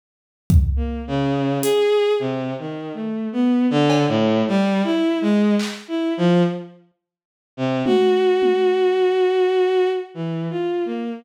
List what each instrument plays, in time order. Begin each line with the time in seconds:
0.50 kick
0.76 violin A#3
1.07 violin C#3
1.62 violin G#4, closed hi-hat
2.20 violin C3
2.59 violin D#3
2.94 violin A3
3.33 violin B3
3.70 violin D3
3.90 cowbell
4.08 violin A2
4.48 violin G3
4.84 violin E4
5.21 violin G#3
5.59 clap
5.88 violin E4
6.17 violin F3
7.57 violin C3
7.85 violin F#4, high tom
8.42 high tom
10.14 violin E3
10.50 violin F4
10.85 violin A#3